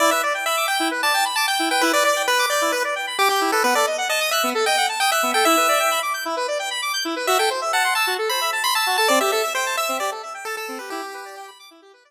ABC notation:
X:1
M:4/4
L:1/16
Q:1/4=132
K:Em
V:1 name="Lead 1 (square)"
d e z2 e2 g2 z a2 z a g2 g | B d d2 B2 d2 B z3 G G2 A | B d z2 ^d2 e2 z g2 z g e2 g | e6 z10 |
e g z2 f2 a2 z b2 z b a2 a | d e e2 c2 e2 d z3 A A2 B | G6 z10 |]
V:2 name="Lead 1 (square)"
E B d g b d' g' E B d g b d' g' E B | E B d g b d' g' E B d g b d' g' E B | B, A ^d f a ^d' f' B, A d f a d' f' B, A | E B d g b d' g' E B d g b d' g' E B |
F A c e a c' e' F A c e a c' e' F A | C G A e g a e' C G A e g a e' C G | E G B d g b d' E G B d z5 |]